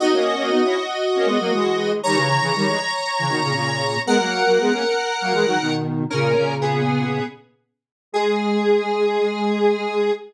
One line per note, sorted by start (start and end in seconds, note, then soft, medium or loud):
0.00 0.12 B3 loud
0.00 0.12 D#4 loud
0.00 1.91 F#4 medium
0.00 1.91 D#5 medium
0.13 0.34 A#3 loud
0.13 0.34 C#4 loud
0.37 0.49 A#3 loud
0.37 0.49 C#4 loud
0.50 0.62 B3 medium
0.50 0.62 D#4 loud
0.63 0.75 C#4 medium
0.63 0.75 E4 loud
1.15 1.27 A#3 loud
1.15 1.27 C#4 loud
1.25 1.37 G#3 loud
1.25 1.37 B3 loud
1.39 1.51 F#3 medium
1.39 1.51 A#3 loud
1.52 2.00 E3 medium
1.52 2.00 G#3 medium
2.03 2.16 D#3 loud
2.03 2.16 G3 loud
2.03 4.00 C#5 medium
2.03 4.00 A#5 loud
2.14 2.39 C#3 loud
2.14 2.39 E3 loud
2.41 2.53 C#3 loud
2.41 2.53 E3 loud
2.56 2.68 D#3 loud
2.56 2.68 G3 loud
2.67 2.79 E3 medium
2.67 2.79 G#3 medium
3.19 3.31 C#3 medium
3.19 3.31 E3 medium
3.29 3.41 B2 loud
3.29 3.41 D#3 loud
3.42 3.53 A#2 medium
3.42 3.53 C#3 loud
3.54 3.97 A#2 medium
3.54 3.97 C#3 loud
4.06 4.18 G#3 loud
4.06 4.18 B3 loud
4.06 5.73 A#4 medium
4.06 5.73 F#5 loud
4.19 4.43 F#3 medium
4.19 4.43 A#3 medium
4.46 4.58 F#3 medium
4.46 4.58 A#3 loud
4.60 4.72 G#3 loud
4.60 4.72 B3 loud
4.71 4.83 A#3 medium
4.71 4.83 C#4 loud
5.21 5.33 F#3 medium
5.21 5.33 A#3 loud
5.33 5.45 E3 loud
5.33 5.45 G#3 loud
5.45 5.57 D#3 medium
5.45 5.57 F#3 loud
5.60 6.04 B2 medium
5.60 6.04 D#3 loud
6.10 6.33 A#2 loud
6.10 6.33 C#3 loud
6.10 6.55 C#4 medium
6.10 6.55 A#4 medium
6.37 7.19 A#2 medium
6.37 7.19 C#3 loud
6.61 7.24 B3 medium
6.61 7.24 G#4 medium
8.12 10.10 G#3 loud
8.12 10.11 G#4 loud